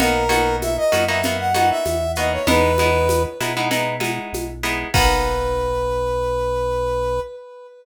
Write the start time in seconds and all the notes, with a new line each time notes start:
0.00 B1 A#3 B3 D#4 F#4 A#4, low conga, shaker
0.29 A#3 B3 D#4 F#4, high conga, shaker
0.62 E5, high conga, shaker
0.77 D#5
0.92 F#2 A#3 B3 D#4 F#4, high conga, shaker
1.08 A#3 B3 D#4 F#4 E5
1.23 A#3 B3 D#4 F#4, low conga, shaker
1.39 F#5
1.54 A#3 B3 D#4 F#4 F#5, high conga, shaker
1.70 E5
1.86 E2, high conga, shaker
2.15 A#3 B3 D#4 F#4 D#5, shaker
2.32 C#5
2.47 E2 G#3 B3 D#4 E4 B4, low conga, shaker
2.78 G#3 B3 D#4 E4, high conga, shaker
3.09 high conga, shaker
3.40 B2 G#3 B3 D#4 E4, high conga, shaker
3.57 G#3 B3 D#4 E4
3.71 G#3 B3 D#4 E4, low conga, shaker
4.00 G#3 B3 D#4 E4, high conga, shaker
4.33 B1, high conga, shaker
4.63 G#3 B3 D#4 E4, shaker
4.94 B1 A#3 B3 D#4 F#4 B4, kick, crash